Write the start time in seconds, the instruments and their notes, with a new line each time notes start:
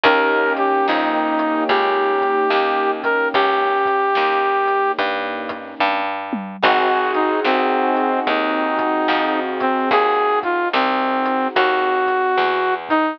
0.04 electric bass (finger) D#2, acoustic grand piano A#3 C#4 D#4 G4, brass section A#4, kick, closed hi-hat
0.57 brass section G4, closed hi-hat
0.87 electric bass (finger) F2, brass section D#4, snare
1.39 closed hi-hat
1.69 electric bass (finger) C#2, brass section G4, kick, closed hi-hat
2.21 kick, closed hi-hat
2.50 electric bass (finger) D#2, snare
3.04 brass section A#4, kick, closed hi-hat
3.34 electric bass (finger) C#2, brass section G4, kick, closed hi-hat
3.86 kick, closed hi-hat
4.15 electric bass (finger) D#2, snare
4.68 closed hi-hat
4.98 electric bass (finger) G2, kick, closed hi-hat
5.49 kick, closed hi-hat
5.80 electric bass (finger) G2, kick
6.33 mid tom
6.63 electric bass (finger) G#1, acoustic grand piano C4 D#4 F#4 G#4, brass section F#4, kick, crash
7.14 brass section D#4, closed hi-hat
7.45 electric bass (finger) C2, brass section C4, snare
7.97 closed hi-hat
8.27 electric bass (finger) D#2, brass section D#4, kick, closed hi-hat
8.79 kick, closed hi-hat
9.08 electric bass (finger) F2, snare
9.60 brass section C4, kick, closed hi-hat
9.91 electric bass (finger) D#2, brass section G#4, kick, closed hi-hat
10.43 brass section F4, kick, closed hi-hat
10.73 electric bass (finger) C2, brass section C4, snare
11.26 closed hi-hat
11.55 electric bass (finger) D#2, brass section F#4, kick, closed hi-hat
12.07 kick, closed hi-hat
12.38 electric bass (finger) E2, snare
12.89 brass section D#4, kick, closed hi-hat